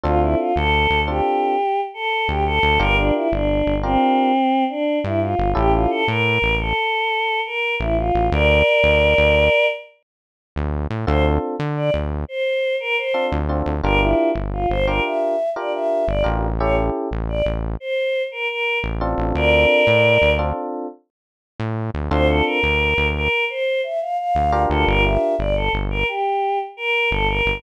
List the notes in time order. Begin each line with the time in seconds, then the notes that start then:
0.04 D2 C4 D4 F4 A4
0.22 E4
0.39 F4
0.56 D2 A4
0.90 D2
1.08 C4 D4 F4 G4 A4
1.94 A4
2.28 D2 G4
2.46 A4
2.63 D2
2.79 G1 D4 F4 G4 A#4
2.97 D4
3.15 E4
3.32 G1 D4
3.66 G1
3.83 C4 D4 F4 G4 A#4
4.70 D4
5.04 G2 E4
5.22 F4
5.39 G1
5.55 A1 C#4 E4 G4 A4
5.74 F4
5.90 A4
6.08 A2 A#4
6.42 A1
6.60 A4
7.46 A#4
7.80 A1 E4
7.98 F4
8.15 A1
8.32 D2 A#4 D5
8.84 D2
9.18 D2
10.56 D2
10.90 A2
11.07 D2 C4 D4 F4 A4 C5
11.59 D3
11.77 D5
11.94 D2
12.28 C5
12.80 A#4
12.97 C5
13.14 C4 D4 F4 A4
13.32 D2
13.49 C4 D4 F4 A4
13.66 D2
13.83 G1 D4 F4 G4 A#4
14.01 E4
14.35 G1
14.53 F4
14.69 G1 C5
14.87 D4 F4 G4 A#4
15.04 E5
15.56 D4 F4 G4 A#4 D5
15.73 E5
16.07 G1 D5
16.24 A1 D4 F4 G4 A#4
16.59 C#4 E4 G4 A4 C#5
17.11 A1
17.29 D5
17.46 A1
17.80 C5
18.31 A#4
18.49 A#4
18.84 A1
19.01 C4 D4 F4 A4
19.18 A1
19.35 D2 A#4 D5
19.87 A2
20.22 D2
20.39 C4 D4 F4 A4
21.60 A2
21.94 D2
22.11 D2 C4 D4 F4 A4 C5
22.28 A4
22.46 A#4
22.63 D2
22.97 D2
23.15 A#4
23.49 C5
23.83 E5
24.01 F5
24.18 F5
24.35 D2
24.52 D4 F4 G4 A#4
24.70 D2 A4
24.87 G1 A#4
25.04 E5
25.39 G1 D5
25.56 A4
25.73 G1
25.90 A#4
26.08 G4
26.77 A#4
27.11 G1 A4
27.28 A#4
27.46 G1